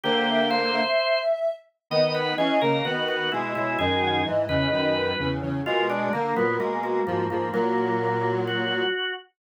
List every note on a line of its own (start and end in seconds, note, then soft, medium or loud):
0.04 0.81 D3 medium
0.04 0.81 A#3 medium
0.04 0.48 G4 loud
0.04 0.27 C5 loud
0.28 0.47 E5 medium
0.50 1.19 C5 medium
0.50 0.71 F5 medium
0.73 1.51 E5 medium
1.90 2.34 D#3 medium
1.90 2.34 B3 medium
1.90 2.13 D#5 medium
2.14 2.35 B4 medium
2.14 2.34 F#5 medium
2.37 2.59 E3 medium
2.37 2.59 C#4 medium
2.37 2.59 G#4 medium
2.37 3.04 D#5 medium
2.61 2.82 C#3 medium
2.61 2.82 A#3 medium
2.61 2.84 A#4 medium
2.85 3.30 D#3 medium
2.85 3.30 B3 medium
2.85 3.06 F#4 medium
3.07 3.30 F#4 medium
3.07 3.29 B4 medium
3.31 3.54 B2 medium
3.31 3.54 G#3 medium
3.31 3.52 E4 medium
3.31 3.52 B4 medium
3.53 3.77 B2 soft
3.53 3.77 G#3 medium
3.53 3.78 E4 loud
3.53 3.73 C#5 medium
3.79 4.22 F#2 medium
3.79 4.22 D#3 medium
3.79 4.22 G#4 loud
3.79 4.02 D#5 medium
4.02 4.24 F#5 medium
4.25 4.46 G#2 soft
4.25 4.46 E3 medium
4.25 4.93 D#5 medium
4.49 4.67 E2 medium
4.49 4.67 C#3 medium
4.49 5.27 B4 medium
4.72 5.13 F#2 medium
4.72 5.13 D#3 medium
4.95 5.16 B4 medium
5.19 5.41 E2 medium
5.19 5.41 C#3 medium
5.19 5.43 B4 medium
5.42 5.62 E2 soft
5.42 5.62 C#3 medium
5.42 5.60 C#5 medium
5.65 6.09 B2 medium
5.65 6.09 G#3 medium
5.65 5.87 F4 loud
5.65 5.87 A#4 medium
5.90 6.12 D4 medium
5.90 6.12 D5 medium
6.13 6.34 D3 medium
6.13 6.34 A#3 medium
6.13 6.35 A#3 medium
6.13 6.75 A#4 medium
6.36 6.58 A#2 soft
6.36 6.58 F#3 medium
6.36 6.56 B3 medium
6.59 7.01 B2 soft
6.59 7.01 G#3 medium
6.59 6.80 A#3 medium
6.83 7.05 A#3 medium
6.83 7.05 F#4 medium
7.07 7.26 G#2 medium
7.07 7.26 F3 medium
7.07 7.25 A#3 medium
7.07 7.28 F#4 medium
7.30 7.49 G#2 soft
7.30 7.49 F3 medium
7.30 7.51 A#3 medium
7.30 7.53 G#4 medium
7.52 8.84 A#2 medium
7.52 8.84 F#3 medium
7.52 8.32 A#3 medium
7.52 7.92 A#4 medium
8.01 8.46 A#4 medium
8.46 8.89 F#4 medium
8.46 9.12 F#4 medium